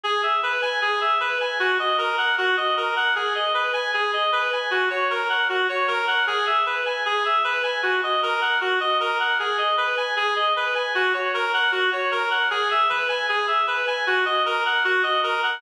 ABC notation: X:1
M:4/4
L:1/8
Q:1/4=154
K:F#mix
V:1 name="Clarinet"
G e B g G e B g | F d A f F d A f | G d B g G d B g | F c A f F c A f |
G e B g G e B g | F d A f F d A f | G d B g G d B g | F c A f F c A f |
G e B g G e B g | F d A f F d A f |]